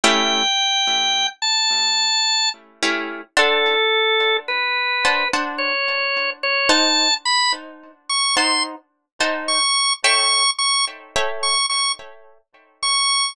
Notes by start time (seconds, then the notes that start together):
0.03 A3 C#4 E4 G4 G5
1.42 A5
2.82 A3 C#4 E4 G4
3.36 D4 A4 C5 F#5 A5
4.48 B4
5.04 D4 C5 F#5 A5
5.33 D4 C5 F#5 A5
5.58 C#5
6.43 C#5
6.69 D#4 C5 F#5 A5
7.25 B5
8.09 C#6
8.36 D#4 C5 F#5 A5 C6
9.20 D#4 C5 F#5 A5
9.48 C#6
10.04 A4 C#5 E5 G5 C#6
10.58 C#6
11.15 A4 C#5 E5 G5
11.43 C#6
11.69 C#6
12.83 C#6